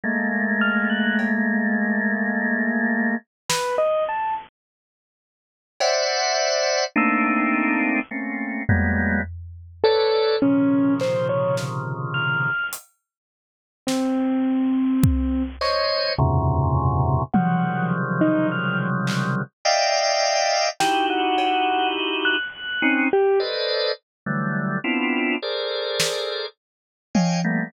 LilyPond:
<<
  \new Staff \with { instrumentName = "Drawbar Organ" } { \time 3/4 \tempo 4 = 52 <aes a bes>2. | r2 <c'' d'' e'' ges''>4 | <a bes c' d' ees'>4 <a bes c' des'>8 <ges g aes bes b>8 r8 <a' b' des'' d''>8 | <bes, c des ees f>2 r4 |
r4. <c'' des'' ees''>8 <e, ges, aes, bes, c des>4 | <c des ees f ges g>2 <d'' ees'' e'' f'' g''>4 | <ees' e' ges' g'>4. r16 <c' des' ees'>16 r16 <a' b' c'' d'' ees''>8 r16 | <d e ges g a>8 <b c' d' e' f'>8 <aes' a' bes' c'' d''>4 r8 <des'' ees'' f'' g'' aes''>16 <g a bes b>16 | }
  \new Staff \with { instrumentName = "Acoustic Grand Piano" } { \time 3/4 r8 f'''16 ges'''16 r2 | b'16 ees''16 a''16 r2 r16 | e'''4 r4. a'8 | des'8 c''16 des''16 r8 f'''8 r4 |
c'4. des'''8 r4 | ges''8 r16 ees'16 f'''16 r4. r16 | g''16 ges''8. r16 ges'''8. g'16 r8. | r2. | }
  \new DrumStaff \with { instrumentName = "Drums" } \drummode { \time 3/4 r4 cb4 r4 | sn4 r4 cb4 | r4 r8 tomfh8 r4 | r8 hc8 sn4 hh4 |
sn4 bd8 hc8 r4 | tommh4 r8 hc8 r4 | sn8 cb8 r4 r4 | r4 r8 sn8 r8 tommh8 | }
>>